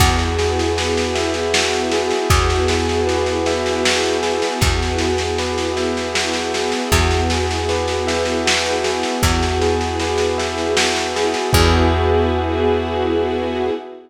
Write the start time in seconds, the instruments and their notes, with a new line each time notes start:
0.00 electric bass (finger) E2, string ensemble 1 B3 E4 F#4 G#4, tubular bells F#4, kick, snare, crash
0.19 snare
0.38 tubular bells G#4, snare
0.59 snare
0.77 tubular bells B4, snare
0.97 snare
1.15 tubular bells E5, snare
1.34 snare
1.54 tubular bells F#4, snare
1.73 snare
1.92 tubular bells G#4, snare
2.11 snare
2.30 electric bass (finger) E2, string ensemble 1 B3 E4 F#4 G#4, tubular bells F#4, kick, snare
2.50 snare
2.68 tubular bells G#4, snare
2.89 snare
3.07 tubular bells B4, snare
3.26 snare
3.46 tubular bells E5, snare
3.66 snare
3.84 tubular bells F#4, snare
4.03 snare
4.23 tubular bells G#4, snare
4.42 snare
4.61 electric bass (finger) E2, string ensemble 1 B3 E4 F#4 G#4, tubular bells F#4, kick, snare
4.82 snare
4.98 tubular bells G#4, snare
5.18 snare
5.38 tubular bells B4, snare
5.58 snare
5.76 tubular bells E5, snare
5.97 snare
6.15 tubular bells F#4, snare
6.33 snare
6.54 tubular bells G#4, snare
6.72 snare
6.92 electric bass (finger) E2, string ensemble 1 B3 E4 F#4 G#4, tubular bells F#4, kick, snare
7.11 snare
7.30 tubular bells G#4, snare
7.51 snare
7.69 tubular bells B4, snare
7.88 snare
8.07 tubular bells E5, snare
8.25 snare
8.46 tubular bells F#4, snare
8.66 snare
8.84 tubular bells G#4, snare
9.03 snare
9.23 electric bass (finger) E2, string ensemble 1 B3 E4 F#4 G#4, tubular bells F#4, kick, snare
9.43 snare
9.62 tubular bells G#4, snare
9.81 snare
10.00 tubular bells B4, snare
10.18 snare
10.38 tubular bells E5, snare
10.58 snare
10.77 tubular bells F#4, snare
10.96 snare
11.16 tubular bells G#4, snare
11.34 snare
11.53 electric bass (finger) E2, string ensemble 1 B3 E4 F#4 G#4, tubular bells F#4 G#4 B4 E5, kick, crash